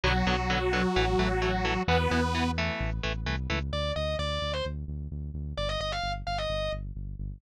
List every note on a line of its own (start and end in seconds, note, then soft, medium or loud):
0.03 0.23 B1 loud
0.03 0.13 D3 medium
0.03 1.83 F#3 medium
0.03 0.13 F#3 medium
0.03 0.13 B3 medium
0.03 1.83 F#4 medium
0.27 0.85 B1 medium
0.27 0.36 D3 medium
0.27 0.36 F#3 medium
0.27 0.36 B3 medium
0.50 0.59 D3 medium
0.50 0.59 F#3 medium
0.50 0.59 B3 medium
0.73 0.82 D3 medium
0.73 0.82 F#3 medium
0.73 0.82 B3 medium
0.96 1.15 A1 loud
0.96 1.05 E3 medium
0.96 1.05 A3 medium
1.19 1.78 A1 medium
1.19 1.28 E3 medium
1.19 1.28 A3 medium
1.42 1.51 E3 medium
1.42 1.51 A3 medium
1.65 1.74 E3 medium
1.65 1.74 A3 medium
1.88 2.07 E2 loud
1.88 1.97 E3 medium
1.88 1.97 B3 medium
1.88 2.51 B3 medium
1.88 2.51 B4 medium
2.11 2.70 E2 medium
2.11 2.20 E3 medium
2.11 2.20 B3 medium
2.35 2.44 E3 medium
2.35 2.44 B3 medium
2.58 2.90 E3 medium
2.58 2.90 A3 medium
2.80 3.00 A1 medium
3.03 3.26 A1 medium
3.03 3.12 E3 medium
3.03 3.12 A3 medium
3.26 3.47 C2 medium
3.26 3.36 E3 medium
3.26 3.36 A3 medium
3.50 3.71 C#2 medium
3.50 3.59 E3 medium
3.50 3.59 A3 medium
3.73 3.92 D2 medium
3.73 3.92 D5 loud
3.96 4.16 D2 medium
3.96 4.16 D#5 medium
4.19 4.39 D2 medium
4.19 4.52 D5 loud
4.42 4.61 D2 medium
4.53 4.64 C5 medium
4.65 4.85 D2 medium
4.88 5.08 D2 medium
5.11 5.31 D2 medium
5.34 5.54 D2 medium
5.57 5.77 G1 medium
5.57 5.68 D5 loud
5.69 5.80 D#5 loud
5.80 6.00 G1 medium
5.80 5.92 D#5 loud
5.92 6.12 F5 loud
6.03 6.23 G1 medium
6.27 6.46 G1 medium
6.27 6.38 F5 medium
6.38 6.71 D#5 medium
6.50 6.69 G1 medium
6.72 6.92 G1 medium
6.95 7.15 G1 medium
7.19 7.39 G1 medium